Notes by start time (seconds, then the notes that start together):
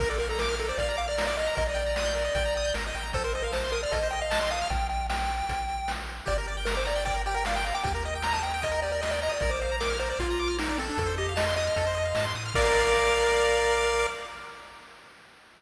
0.00 A#1 A#4, kick, crash
0.09 A4 D5
0.18 A#4 F5, closed hi-hat
0.29 A4 A#5
0.39 A#4 D6, snare
0.49 F6
0.58 A4 A#4, closed hi-hat
0.68 C5 D5
0.78 A#1 D5 F5, kick, closed hi-hat
0.88 A#5
0.97 F5 D6, closed hi-hat
1.08 D5 F6
1.18 A#4, snare
1.27 D5
1.37 D#5 F5, closed hi-hat
1.47 A#5
1.55 A#1 A#4 D#5, kick, closed hi-hat
1.67 D5 D#5
1.75 G5, closed hi-hat
1.86 A#5
1.96 D#6, snare
2.06 G6
2.15 A#4, closed hi-hat
2.25 D#5
2.35 A#1 G5, kick, closed hi-hat
2.45 A#5
2.56 D#6, closed hi-hat
2.64 G6
2.74 G#1 A#4, snare
2.86 D#5
2.95 A1 G5, closed hi-hat
3.03 A#5
3.13 A#1 A4 C5, kick, closed hi-hat
3.24 A#4 C5
3.33 C5 D#5, closed hi-hat
3.42 A#4 F5
3.52 C5 A5, snare
3.64 C6
3.72 A#4 D#6, closed hi-hat
3.83 D5 F6
3.91 A#1 A4 D#5, kick, closed hi-hat
4.03 C5
4.11 D#5 G5, closed hi-hat
4.21 D#5 F5
4.30 A5, snare
4.40 D#5 C6
4.50 F5 D#6, closed hi-hat
4.62 F6
4.70 A#1 G5, kick, closed hi-hat
4.89 G5, closed hi-hat
5.10 G5, snare
5.29 closed hi-hat
5.49 A#1, kick, closed hi-hat
5.69 closed hi-hat
5.88 snare
6.08 closed hi-hat
6.25 G1 G4 D5, kick, closed hi-hat
6.38 A#4
6.47 D5, closed hi-hat
6.57 G5
6.65 A#4 A#5, snare
6.75 C5 D6
6.85 D5 A#5, closed hi-hat
6.95 G5
7.05 D5 G5, kick, closed hi-hat
7.14 A#4
7.26 G4 G5, closed hi-hat
7.34 A#4 G5
7.45 D5 F5, snare
7.56 G5
7.64 F5 A#5, closed hi-hat
7.74 G5 D6
7.83 D#2 G4 G5, kick, closed hi-hat
7.94 A#4
8.03 D#5, closed hi-hat
8.15 G5
8.22 A#5, snare
8.33 A5 D#6
8.43 G5 A#5, closed hi-hat
8.54 G5
8.62 D#5, kick, closed hi-hat
8.72 A#4
8.82 G4 D5, closed hi-hat
8.92 A#4 D5
9.01 D#5, snare
9.11 D5 G5
9.22 D#5 A#5, open hi-hat
9.29 D5 D#6
9.40 A#1 A#4 D5, kick, closed hi-hat
9.50 C5 D5
9.60 C5 F5, closed hi-hat
9.71 A#5
9.80 A#4 D6, snare
9.90 F6
9.99 A#4 C5, closed hi-hat
10.09 C5 D5
10.19 A#1 F4 F5, kick, closed hi-hat
10.30 A#5
10.39 D6, closed hi-hat
10.48 F6
10.58 D#4 A#4, snare
10.69 D#4 D5
10.78 C4 A4, closed hi-hat
10.89 D4
10.98 F2 A4, kick, closed hi-hat
11.06 C5
11.18 G4 D#5, closed hi-hat
11.29 F5
11.36 D#5 A5, snare
11.47 C6
11.56 D#5 D#6, closed hi-hat
11.67 F6
11.76 F2 A4, kick, closed hi-hat
11.87 C5
11.95 D#5, closed hi-hat
12.05 F5
12.15 G#2 A5, snare
12.24 C6
12.35 A2 D#6, closed hi-hat
12.46 F6
12.54 A#1 A#4 D5 F5, kick, crash